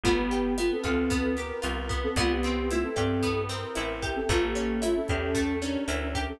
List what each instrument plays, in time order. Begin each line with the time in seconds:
0.04 electric bass (finger) G1, flute A3 F4, acoustic guitar (steel) B3, kick, closed hi-hat
0.17 flute B3 G4
0.31 acoustic guitar (steel) G4, closed hi-hat
0.57 flute A3 F4, acoustic guitar (steel) B3, cross-stick, closed hi-hat
0.71 flute C4 A4
0.84 electric bass (finger) D2, flute C4 A4, acoustic guitar (steel) F4, kick, closed hi-hat
1.10 acoustic guitar (steel) B3, kick, closed hi-hat
1.37 acoustic guitar (steel) G4, flute A#4, snare, closed hi-hat
1.62 electric bass (finger) C2, acoustic guitar (steel) F4, closed hi-hat
1.89 acoustic guitar (steel) B3, kick, closed hi-hat
2.03 flute C4 A4
2.16 electric bass (finger) C2, flute A3 F4, acoustic guitar (steel) B3, kick, cross-stick, closed hi-hat
2.30 flute B3 G4
2.43 acoustic guitar (steel) C4, closed hi-hat
2.70 flute A3 F4, acoustic guitar (steel) E4, closed hi-hat
2.83 flute C4 A4
2.96 electric bass (finger) G2, flute C4 A4, acoustic guitar (steel) G4, kick, cross-stick, closed hi-hat
3.23 acoustic guitar (steel) B3, kick, closed hi-hat
3.49 acoustic guitar (steel) C4, flute A#4, snare, closed hi-hat
3.75 electric bass (finger) A1, acoustic guitar (steel) E4, cross-stick, closed hi-hat
4.02 acoustic guitar (steel) G4, kick, closed hi-hat
4.16 flute C4 A4
4.29 electric bass (finger) A1, acoustic guitar (steel) A3, flute A3 F4, kick, closed hi-hat
4.42 flute A#3 G4
4.55 acoustic guitar (steel) C#4, closed hi-hat
4.82 flute A3 F4, acoustic guitar (steel) E4, cross-stick, closed hi-hat
4.96 flute C#4 A4
5.08 electric bass (finger) E2, flute C#4 A4, acoustic guitar (steel) G4, kick, closed hi-hat
5.35 acoustic guitar (steel) A3, kick, closed hi-hat
5.62 acoustic guitar (steel) C#4, flute D4 A#4, snare, closed hi-hat
5.88 electric bass (finger) D2, acoustic guitar (steel) E4, closed hi-hat
6.15 acoustic guitar (steel) G4, kick, closed hi-hat
6.28 flute C#4 A4